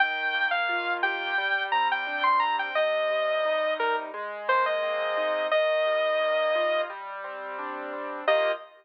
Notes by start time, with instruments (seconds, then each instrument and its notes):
0.00 acoustic grand piano D#3, lead 2 (sawtooth) G5
0.34 acoustic grand piano A#3
0.51 lead 2 (sawtooth) F5
0.69 acoustic grand piano F4
1.03 acoustic grand piano G4, lead 2 (sawtooth) G5
1.38 acoustic grand piano G3
1.72 acoustic grand piano C4, lead 2 (sawtooth) A#5
1.92 lead 2 (sawtooth) G5
2.07 acoustic grand piano D4
2.23 lead 2 (sawtooth) C6
2.40 acoustic grand piano C4, lead 2 (sawtooth) A#5
2.59 lead 2 (sawtooth) G5
2.75 acoustic grand piano C3, lead 2 (sawtooth) D#5
3.10 acoustic grand piano G3
3.45 acoustic grand piano D#4
3.79 acoustic grand piano G3, lead 2 (sawtooth) A#4
4.14 acoustic grand piano G#3
4.48 acoustic grand piano A#3, lead 2 (sawtooth) C5
4.66 lead 2 (sawtooth) D#5
4.83 acoustic grand piano C4
5.17 acoustic grand piano D#4
5.51 acoustic grand piano D#3, lead 2 (sawtooth) D#5
5.86 acoustic grand piano G3
6.21 acoustic grand piano A#3
6.55 acoustic grand piano F4
6.90 acoustic grand piano G3
7.24 acoustic grand piano C4
7.59 acoustic grand piano D4
7.93 acoustic grand piano C4
8.28 acoustic grand piano D#3 A#3 F4 G4, lead 2 (sawtooth) D#5